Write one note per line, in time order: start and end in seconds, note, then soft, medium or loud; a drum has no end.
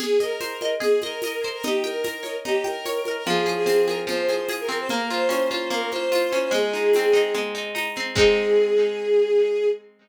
0.00 0.80 G#4 medium
0.00 0.19 G#4 loud
0.00 crash medium
0.00 low conga loud
0.00 shaker medium
0.20 0.71 A#4 medium
0.20 0.61 D#5 medium
0.20 shaker medium
0.40 1.44 C5 medium
0.40 tambourine medium
0.40 high conga medium
0.40 shaker medium
0.61 1.03 D#5 medium
0.61 high conga medium
0.61 shaker medium
0.80 1.58 G#4 medium
0.80 1.00 G#4 medium
0.80 low conga medium
0.80 shaker medium
1.01 1.47 A#4 medium
1.01 1.23 D#5 medium
1.01 high conga medium
1.01 shaker medium
1.22 1.62 D#5 medium
1.22 tambourine medium
1.22 high conga medium
1.22 shaker medium
1.43 1.64 C5 medium
1.43 shaker medium
1.53 1.63 A#4 medium
1.63 2.45 D#4 medium
1.63 1.83 G4 medium
1.63 low conga loud
1.63 shaker medium
1.84 2.36 A#4 medium
1.84 2.64 G5 medium
1.84 high conga medium
1.84 shaker medium
2.04 3.07 A#4 medium
2.04 tambourine medium
2.04 high conga medium
2.04 shaker medium
2.23 2.85 C#5 medium
2.23 high conga medium
2.23 shaker medium
2.45 3.23 D#4 medium
2.45 2.64 G4 medium
2.45 low conga medium
2.45 shaker medium
2.64 3.12 A#4 medium
2.64 3.22 G5 medium
2.64 high conga medium
2.64 shaker medium
2.85 3.25 C#5 medium
2.85 tambourine medium
2.85 high conga medium
2.85 shaker medium
3.05 3.27 A#4 medium
3.05 high conga medium
3.05 shaker medium
3.16 3.26 A#4 medium
3.27 4.06 F3 loud
3.27 3.43 G#4 loud
3.27 low conga medium
3.27 shaker medium
3.46 3.87 G#4 medium
3.46 high conga medium
3.46 shaker medium
3.56 3.65 G#4 loud
3.66 4.68 C4 medium
3.66 3.85 G#4 medium
3.66 tambourine medium
3.66 high conga medium
3.66 shaker medium
3.87 4.29 G#4 medium
3.87 3.97 A#4 medium
3.87 high conga medium
3.87 shaker medium
4.07 4.85 F3 medium
4.07 4.47 C5 medium
4.07 low conga medium
4.07 shaker medium
4.29 4.49 G#4 medium
4.29 high conga medium
4.29 shaker medium
4.49 4.88 G#4 medium
4.49 tambourine medium
4.49 high conga medium
4.49 shaker medium
4.60 4.78 A#4 medium
4.69 4.88 C4 medium
4.69 shaker medium
4.79 4.89 C5 medium
4.89 5.70 A#3 medium
4.89 5.07 A#4 loud
4.89 low conga medium
4.89 shaker medium
5.10 5.50 F4 medium
5.10 5.69 C5 medium
5.10 shaker medium
5.29 6.32 C#4 medium
5.29 tambourine medium
5.29 high conga medium
5.29 shaker medium
5.51 5.92 F4 medium
5.51 high conga medium
5.51 shaker medium
5.70 6.48 A#3 medium
5.70 5.90 A#4 medium
5.70 low conga medium
5.70 shaker medium
5.91 6.11 F4 medium
5.91 6.39 C5 loud
5.91 high conga medium
5.91 shaker medium
6.12 6.51 F4 medium
6.12 tambourine medium
6.12 high conga medium
6.12 shaker medium
6.32 6.52 C#4 medium
6.32 high conga medium
6.32 shaker medium
6.42 6.52 C5 medium
6.51 7.34 G#3 loud
6.51 7.30 G#4 loud
6.51 low conga medium
6.51 shaker medium
6.73 7.13 D#4 medium
6.73 shaker medium
6.93 7.96 C4 medium
6.93 tambourine medium
6.93 high conga medium
6.93 shaker medium
7.13 7.54 D#4 medium
7.13 shaker medium
7.34 8.12 G#3 medium
7.34 low conga medium
7.34 shaker medium
7.55 7.74 D#4 medium
7.55 shaker medium
7.75 8.14 D#4 medium
7.75 tambourine medium
7.75 high conga medium
7.75 shaker medium
7.95 8.16 C4 medium
7.95 shaker medium
8.15 9.66 G#3 medium
8.15 9.66 C4 medium
8.15 9.66 D#4 loud
8.15 9.66 G#4 loud
8.15 kick loud
8.15 crash loud